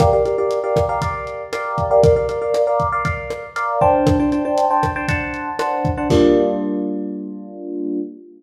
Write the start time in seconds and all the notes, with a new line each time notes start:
0.00 G4 A#4 D5 F5, kick, cross-stick, closed hi-hat
0.13 G4 A#4 D5 F5
0.25 G4 A#4 D5 F5, closed hi-hat
0.38 G4 A#4 D5 F5
0.51 closed hi-hat
0.64 G4 A#4 D5 F5
0.76 kick, cross-stick, closed hi-hat
0.89 G4 A#4 D5 F5
1.02 G4 A#4 D5 F5, kick, closed hi-hat
1.27 closed hi-hat
1.53 G4 A#4 D5 F5, cross-stick, closed hi-hat
1.78 kick, closed hi-hat
1.91 G4 A#4 D5 F5
2.03 A#4 D5 F5, kick, closed hi-hat
2.16 A#4 D5 F5
2.29 A#4 D5 F5, closed hi-hat
2.42 A#4 D5 F5
2.54 cross-stick, closed hi-hat
2.67 A#4 D5 F5
2.80 kick, closed hi-hat
2.92 A#4 D5 F5
3.05 A#4 D5 F5, kick, closed hi-hat
3.30 cross-stick, closed hi-hat
3.56 A#4 D5 F5, closed hi-hat
3.81 D4 C5 G5 A5, kick
4.07 kick, cross-stick, closed hi-hat
4.19 D4 C5 G5 A5
4.32 D4 C5 G5 A5, closed hi-hat
4.45 D4 C5 G5 A5
4.58 closed hi-hat
4.70 D4 C5 G5 A5
4.83 kick, cross-stick, closed hi-hat
4.96 D4 C5 G5 A5
5.08 D4 C5 F#5 A5, kick, closed hi-hat
5.34 closed hi-hat
5.59 D4 C5 F#5 A5, cross-stick, closed hi-hat
5.85 kick, closed hi-hat
5.97 D4 C5 F#5 A5
6.10 G3 A#3 D4 F4, kick, crash